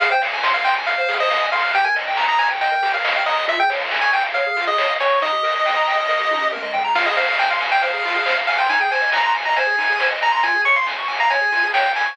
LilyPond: <<
  \new Staff \with { instrumentName = "Lead 1 (square)" } { \time 4/4 \key f \minor \tempo 4 = 138 f''16 g''16 r8. f''16 g''16 r16 f''8. ees''8. f''8 | g''16 aes''16 r8. bes''16 aes''16 r16 g''8. f''8. ees''8 | e''16 g''16 r8. aes''16 g''16 r16 f''8. ees''8. des''8 | ees''2. r4 |
f''16 ees''16 f''8 g''16 f''16 r16 g''16 f''4. f''16 g''16 | aes''16 g''16 aes''8 bes''16 bes''16 r16 bes''16 aes''4. bes''16 bes''16 | aes''8 des'''16 c'''16 r8. bes''16 aes''4 g''8 aes''8 | }
  \new Staff \with { instrumentName = "Lead 1 (square)" } { \time 4/4 \key f \minor aes'16 c''16 f''16 aes''16 c'''16 f'''16 c'''16 aes''16 f''16 c''16 aes'16 c''16 f''16 aes''16 c'''16 f'''16 | g'16 bes'16 ees''16 g''16 bes''16 ees'''16 bes''16 g''16 ees''16 bes'16 g'16 bes'16 ees''16 g''16 bes''16 ees'''16 | f'16 aes'16 des''16 f''16 aes''16 des'''16 aes''16 f''16 des''16 aes'16 f'16 aes'16 des''16 f''16 aes''16 des'''16 | ees'16 g'16 bes'16 ees''16 g''16 bes''16 g''16 ees''16 bes'16 g'16 ees'16 g'16 bes'16 ees''16 g''16 bes''16 |
f'16 aes'16 c''16 f''16 aes''16 c'''16 aes''16 f''16 c''16 aes'16 f'16 aes'16 c''16 f''16 aes''16 c'''16 | ees'16 aes'16 c''16 ees''16 aes''16 c'''16 aes''16 ees''16 c''16 aes'16 ees'16 aes'16 c''16 ees''16 aes''16 c'''16 | f'16 aes'16 des''16 f''16 aes''16 des'''16 aes''16 f''16 des''16 aes'16 f'16 aes'16 des''16 f''16 aes''16 des'''16 | }
  \new Staff \with { instrumentName = "Synth Bass 1" } { \clef bass \time 4/4 \key f \minor f,8 f,8 f,8 f,8 f,8 f,8 f,8 f,8 | ees,8 ees,8 ees,8 ees,8 ees,8 ees,8 ees,8 ees,8 | des,8 des,8 des,8 des,8 des,8 des,8 des,8 des,8 | ees,8 ees,8 ees,8 ees,8 ees,8 ees,8 ees,8 ees,8 |
f,8 f,8 f,8 f,8 f,8 f,8 f,8 f,8 | aes,,8 aes,,8 aes,,8 aes,,8 aes,,8 aes,,8 aes,,8 aes,,8 | des,8 des,8 des,8 des,8 des,8 des,8 des,8 des,8 | }
  \new DrumStaff \with { instrumentName = "Drums" } \drummode { \time 4/4 <hh bd>8 hho8 <bd sn>8 hho8 <hh bd>8 hho8 <bd sn>8 hho8 | <hh bd>8 hho8 <bd sn>8 hho8 <hh bd>8 hho8 <bd sn>8 hho8 | <hh bd>8 hho8 <bd sn>8 hho8 <hh bd>8 hho8 <bd sn>8 hho8 | <hh bd>8 hho8 <bd sn>8 hho8 <bd sn>8 tommh8 toml8 tomfh8 |
<cymc bd>8 hho8 <bd sn>8 hho8 <hh bd>8 hho8 <bd sn>8 hho8 | <hh bd>8 hho8 <bd sn>8 hho8 <hh bd>8 hho8 <bd sn>8 hho8 | <hh bd>8 hho8 <bd sn>8 hho8 <hh bd>8 hho8 <bd sn>8 hho8 | }
>>